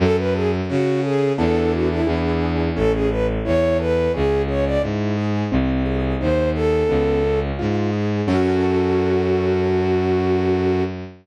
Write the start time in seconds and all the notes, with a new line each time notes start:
0.00 F#2 C#4 A4
0.17 B4
0.34 G#4 A4
0.69 C#3 F#4
1.03 G#4 A4
1.38 E2 B3 D4 E4 A4
1.72 F#4
1.90 E4
2.06 E2 B3 D4 E4 G#4
2.76 A1 C#4 A4
2.93 G#4
3.10 A4 B4
3.45 E2 E4 C#5
3.80 A4 B4
4.14 C#2 C#4 G#4
4.48 G#4 C#5
4.66 D5
4.82 G#2 E4
5.17 G#4
5.52 C2 C4
5.85 G#4
6.21 D#2 D#4 C5
6.55 G#4 A4
6.89 C#2 B3
7.24 C#4
7.59 G#2 F4
7.93 G#4
8.27 F#2 C#4 F#4 A4